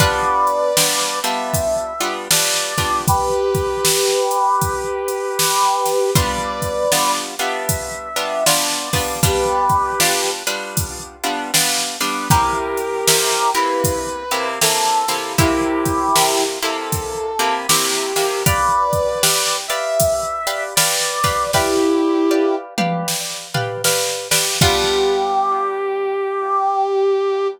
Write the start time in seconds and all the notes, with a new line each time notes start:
0.00 G3 B3 D4 F4 B4 D5, kick, closed hi-hat
0.47 closed hi-hat
0.77 G3 B3 D4 F4, snare
1.23 G3 B3 D4 F4 E5, closed hi-hat
1.54 kick, closed hi-hat
2.00 G3 B3 D4 F4, closed hi-hat
2.31 G3 B3 D4 F4 D5, snare
2.78 G3 B3 D4 F4, kick, snare, closed hi-hat
3.08 G4 B4, kick, closed hi-hat
3.55 kick, closed hi-hat
3.85 snare
4.31 closed hi-hat
4.61 kick, closed hi-hat
5.08 closed hi-hat
5.39 snare
5.86 snare, closed hi-hat
6.15 G3 B3 D4 F4 B4 D5, kick, closed hi-hat
6.62 kick, closed hi-hat
6.92 G3 B3 D4 F4, snare
7.39 G3 B3 D4 F4 E5, closed hi-hat
7.69 kick, closed hi-hat
8.16 G3 B3 D4 F4, closed hi-hat
8.46 G3 B3 D4 F4 D5, snare
8.93 G3 B3 D4 F4, kick, snare, open hi-hat
9.23 G3 B3 D4 F4 G4 B4, kick, closed hi-hat
9.69 kick, closed hi-hat
10.00 G3 B3 D4 F4, snare
10.47 G3 B3 D4 F4, closed hi-hat
10.77 kick, closed hi-hat
11.24 G3 B3 D4 F4, closed hi-hat
11.54 G3 B3 D4 F4, snare
12.00 G3 B3 D4 F4, snare, closed hi-hat
12.30 C3 A#3 E4 G4 A#4, kick, closed hi-hat
12.77 closed hi-hat
13.08 C3 A#3 E4 G4, snare
13.54 C3 A#3 E4 G4 B4, closed hi-hat
13.84 kick, closed hi-hat
14.31 C3 A#3 E4 G4, closed hi-hat
14.61 C3 A#3 E4 G4 A4, snare
15.08 C3 A#3 E4 G4, snare, closed hi-hat
15.38 C3 A#3 E4 G4, kick, closed hi-hat
15.85 kick, closed hi-hat
16.16 C3 A#3 E4 G4, snare
16.62 C3 A#3 E4 G4 A4, closed hi-hat
16.92 kick, closed hi-hat
17.39 C3 A#3 E4 G4, closed hi-hat
17.68 C3 A#3 E4 G4, snare
18.16 C3 A#3 E4 G4, snare, closed hi-hat
18.46 G4 B4 D5 F5, kick, closed hi-hat
18.93 kick, closed hi-hat
19.23 G4 B4 D5 F5, snare
19.68 G4 B4 D5 E5 F5, closed hi-hat
20.00 kick, closed hi-hat
20.47 G4 B4 D5 F5, closed hi-hat
20.75 G4 B4 D5 F5, snare
21.24 G4 B4 D5 F5, kick, snare, closed hi-hat
21.53 E4 G4 B4 D5 F5, kick, snare
22.31 G4 B4 D5 F5
22.78 G4 B4 D5 F5, mid tom
23.08 snare
23.54 G4 B4 D5 F5, floor tom
23.84 G4 B4 D5 F5, snare
24.31 G4 B4 D5 F5, snare
24.61 G3 B3 D4 F4 G4, kick, crash